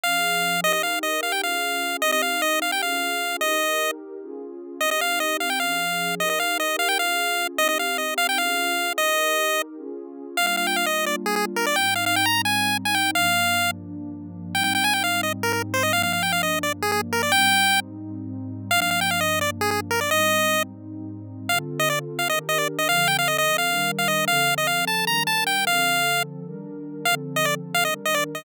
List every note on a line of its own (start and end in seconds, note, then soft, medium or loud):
0.03 0.63 F3 medium
0.03 0.63 C#4 medium
0.03 0.63 G#4 medium
0.03 0.61 F5 medium
0.63 1.42 D#4 medium
0.63 1.42 G4 medium
0.63 1.42 A#4 medium
0.63 0.72 D#5 medium
0.73 0.82 D#5 medium
0.83 0.99 F5 medium
1.03 1.21 D#5 medium
1.23 1.32 F5 medium
1.32 1.42 G5 medium
1.43 2.02 C#4 medium
1.43 2.02 F4 medium
1.43 2.02 G#4 medium
1.43 1.97 F5 medium
2.02 2.81 C4 medium
2.02 2.81 D#4 medium
2.02 2.81 G4 medium
2.02 2.11 D#5 medium
2.12 2.22 D#5 medium
2.22 2.41 F5 medium
2.42 2.60 D#5 medium
2.62 2.71 F5 medium
2.72 2.82 G5 medium
2.82 3.41 C#4 medium
2.82 3.41 F4 medium
2.82 3.41 G#4 medium
2.82 3.37 F5 medium
3.41 4.20 D#4 medium
3.41 4.20 G4 medium
3.41 4.20 A#4 medium
3.41 3.91 D#5 medium
4.21 4.80 C#4 medium
4.21 4.80 F4 medium
4.21 4.80 G#4 medium
4.81 5.59 C4 medium
4.81 5.59 D#4 medium
4.81 5.59 G4 medium
4.81 4.90 D#5 medium
4.91 5.01 D#5 medium
5.01 5.19 F5 medium
5.20 5.37 D#5 medium
5.40 5.50 F5 medium
5.50 5.59 G5 medium
5.60 6.19 F3 medium
5.60 6.19 C#4 medium
5.60 6.19 G#4 medium
5.60 6.15 F5 medium
6.20 6.98 D#4 medium
6.20 6.98 G4 medium
6.20 6.98 A#4 medium
6.20 6.29 D#5 medium
6.30 6.39 D#5 medium
6.40 6.58 F5 medium
6.60 6.76 D#5 medium
6.79 6.88 F5 medium
6.88 6.98 G5 medium
6.99 7.58 C#4 medium
6.99 7.58 F4 medium
6.99 7.58 G#4 medium
6.99 7.47 F5 medium
7.58 8.37 C4 medium
7.58 8.37 D#4 medium
7.58 8.37 G4 medium
7.58 7.68 D#5 medium
7.69 7.78 D#5 medium
7.79 7.97 F5 medium
7.98 8.14 D#5 medium
8.18 8.27 F5 medium
8.29 8.38 G5 medium
8.38 8.97 C#4 medium
8.38 8.97 F4 medium
8.38 8.97 G#4 medium
8.38 8.93 F5 medium
8.98 9.76 D#4 medium
8.98 9.76 G4 medium
8.98 9.76 A#4 medium
8.98 9.62 D#5 medium
9.77 10.36 C#4 medium
9.77 10.36 F4 medium
9.77 10.36 G#4 medium
10.37 11.75 G3 medium
10.37 11.75 A#3 medium
10.37 11.75 D4 medium
10.37 11.75 F4 medium
10.37 10.46 F5 medium
10.47 10.56 F5 medium
10.57 10.67 F5 medium
10.67 10.76 G5 medium
10.76 10.86 F5 medium
10.86 11.05 D#5 medium
11.06 11.16 D5 medium
11.26 11.35 G#4 medium
11.36 11.45 G#4 medium
11.56 11.66 A#4 medium
11.66 11.76 D5 medium
11.76 13.13 G#2 medium
11.76 13.13 G3 medium
11.76 13.13 C4 medium
11.76 13.13 D#4 medium
11.76 11.94 G5 medium
11.96 12.05 F5 medium
12.06 12.16 F5 medium
12.16 12.26 G5 medium
12.26 12.42 A#5 medium
12.45 12.77 G#5 medium
12.85 12.95 G#5 medium
12.95 13.11 G5 medium
13.15 14.53 G2 medium
13.15 14.53 F3 medium
13.15 14.53 A#3 medium
13.15 14.53 D4 medium
13.15 13.71 F5 medium
14.54 15.92 G#2 medium
14.54 15.92 G3 medium
14.54 15.92 C4 medium
14.54 15.92 D#4 medium
14.54 14.63 G5 medium
14.64 14.73 G5 medium
14.75 14.84 G5 medium
14.84 14.94 G#5 medium
14.93 15.03 G5 medium
15.04 15.21 F5 medium
15.23 15.33 D#5 medium
15.43 15.52 A#4 medium
15.53 15.62 A#4 medium
15.74 15.83 C5 medium
15.83 15.92 D#5 medium
15.93 17.31 G2 medium
15.93 17.31 F3 medium
15.93 17.31 A#3 medium
15.93 17.31 D4 medium
15.93 16.02 F5 medium
16.03 16.13 F5 medium
16.13 16.23 F5 medium
16.23 16.32 G5 medium
16.32 16.42 F5 medium
16.43 16.59 D#5 medium
16.63 16.73 D5 medium
16.82 16.91 G#4 medium
16.92 17.01 G#4 medium
17.13 17.22 A#4 medium
17.23 17.32 D5 medium
17.32 18.70 G#2 medium
17.32 18.70 G3 medium
17.32 18.70 C4 medium
17.32 18.70 D#4 medium
17.32 17.80 G5 loud
18.71 20.09 G2 medium
18.71 20.09 F3 medium
18.71 20.09 A#3 medium
18.71 20.09 D4 medium
18.71 18.80 F5 loud
18.82 18.90 F5 medium
18.91 19.00 F5 medium
19.01 19.10 G5 medium
19.11 19.20 F5 medium
19.21 19.39 D#5 medium
19.41 19.50 D5 medium
19.61 19.70 G#4 medium
19.71 19.80 G#4 medium
19.91 20.00 A#4 medium
20.01 20.10 D5 medium
20.10 21.48 G#2 medium
20.10 21.48 G3 medium
20.10 21.48 C4 medium
20.10 21.48 D#4 medium
20.10 20.63 D#5 medium
21.49 22.28 D3 medium
21.49 22.28 C4 medium
21.49 22.28 F4 medium
21.49 22.28 A4 medium
21.49 21.59 F5 medium
21.79 21.89 D#5 medium
21.90 21.99 D5 medium
22.19 22.28 F5 medium
22.29 22.88 D#3 medium
22.29 22.88 D4 medium
22.29 22.88 G4 medium
22.29 22.88 A#4 medium
22.29 22.39 D#5 medium
22.49 22.58 D#5 medium
22.58 22.68 D5 medium
22.78 22.88 D#5 medium
22.89 23.67 D3 medium
22.89 23.67 F3 medium
22.89 23.67 C4 medium
22.89 23.67 A4 medium
22.89 23.08 F5 medium
23.08 23.17 G5 medium
23.19 23.28 F5 medium
23.28 23.37 D#5 medium
23.38 23.57 D#5 medium
23.58 23.91 F5 medium
23.68 24.27 D#3 medium
23.68 24.27 G3 medium
23.68 24.27 D4 medium
23.68 24.27 A#4 medium
23.99 24.08 F5 medium
24.08 24.25 D#5 medium
24.27 25.06 D3 medium
24.27 25.06 F3 medium
24.27 25.06 C4 medium
24.27 25.06 A4 medium
24.27 24.54 F5 medium
24.58 24.67 D#5 medium
24.67 24.85 F5 medium
24.87 25.05 A5 medium
25.07 25.66 D#3 medium
25.07 25.66 G3 medium
25.07 25.66 D4 medium
25.07 25.66 A#4 medium
25.07 25.23 A#5 medium
25.27 25.44 A5 medium
25.47 25.65 G5 medium
25.67 26.45 D3 medium
25.67 26.45 F3 medium
25.67 26.45 C4 medium
25.67 26.45 A4 medium
25.67 26.23 F5 medium
26.46 27.05 D#3 medium
26.46 27.05 G3 medium
26.46 27.05 D4 medium
26.46 27.05 A#4 medium
27.05 27.85 D3 medium
27.05 27.85 F3 medium
27.05 27.85 C4 medium
27.05 27.85 A4 medium
27.05 27.15 F5 medium
27.36 27.46 D#5 medium
27.45 27.55 D5 medium
27.74 27.84 F5 medium
27.85 28.44 D#3 medium
27.85 28.44 G3 medium
27.85 28.44 D4 medium
27.85 28.44 A#4 medium
27.85 27.94 D#5 medium
28.05 28.15 D#5 medium
28.14 28.24 D5 medium
28.35 28.44 D#5 medium